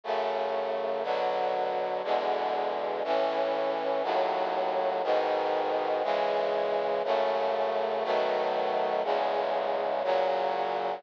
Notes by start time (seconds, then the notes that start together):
0.04 F#2 C#3 A3
1.03 B2 D3 F#3
2.04 E2 B2 D3 G#3
3.04 A2 E3 C#4
4.03 D#2 A2 F#3
5.03 G#2 B2 D#3
6.03 C#3 E3 G#3
7.04 F#2 C#3 A3
8.04 B2 D#3 F#3 A3
9.04 E2 C#3 G#3
10.04 A#2 C#3 F#3